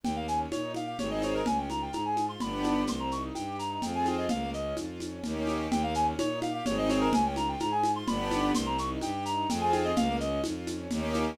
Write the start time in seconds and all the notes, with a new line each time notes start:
0.04 D#2 A#3 G5, low conga, shaker
0.16 F5
0.28 C#4 G#5, shaker
0.51 A#2 D#4 C#5, high conga, shaker
0.75 G4 F5, high conga, shaker
0.87 F5
0.98 G#1 C4 D#4 G#4 C#5, low conga, shaker
1.11 D#5
1.22 C#5, high conga, shaker
1.34 A#4
1.46 C#2 C#4 G#5, low conga, shaker
1.58 G5
1.70 F4 A#5, high conga, shaker
1.82 G5
1.93 G#2 G#4 A#5, high conga, shaker
2.05 G#5
2.17 F4, high conga, shaker
2.29 C6
2.40 G1 B3 D4 G4 B5, low conga, shaker
2.64 high conga, shaker
2.87 C2 C4 C6, low conga, shaker
3.00 A#5
3.11 D#4 C#6, shaker
3.35 G2 G4 G5, high conga, shaker
3.59 D#4 A#5, shaker
3.70 A#5
3.82 F2 C4 F4 G#4 G5, low conga, shaker
3.95 G#5
4.06 G5, high conga, shaker
4.18 D#5
4.29 C#2 A#3 F5, low conga, shaker
4.54 C#4 D#5, shaker
4.77 F2 F4, high conga, shaker
5.00 C#4, high conga, shaker
5.24 D#2 A#3 C#4 D#4 G4, low conga, shaker
5.47 high conga, shaker
5.71 D#2 A#3 G5, low conga, shaker
5.83 F5
5.94 C#4 G#5, shaker
6.18 A#2 D#4 C#5, high conga, shaker
6.42 G4 F5, high conga, shaker
6.54 F5
6.66 G#1 C4 D#4 G#4 C#5, low conga, shaker
6.78 D#5
6.89 C#5, high conga, shaker
7.01 A#4
7.13 C#2 C#4 G#5, low conga, shaker
7.26 G5
7.36 F4 A#5, high conga, shaker
7.49 G5
7.60 G#2 G#4 A#5, high conga, shaker
7.72 G#5
7.83 F4, high conga, shaker
7.96 C6
8.07 G1 B3 D4 G4 B5, low conga, shaker
8.31 high conga, shaker
8.55 C2 C4 C6, low conga, shaker
8.66 A#5
8.78 D#4 C#6, shaker
9.01 G2 G4 G5, high conga, shaker
9.25 D#4 A#5, shaker
9.37 A#5
9.49 F2 C4 F4 G#4 G5, low conga, shaker
9.61 G#5
9.73 G5, high conga, shaker
9.84 D#5
9.96 C#2 A#3 F5, low conga, shaker
10.20 C#4 D#5, shaker
10.44 F2 F4, high conga, shaker
10.67 C#4, high conga, shaker
10.91 D#2 A#3 C#4 D#4 G4, low conga, shaker
11.14 high conga, shaker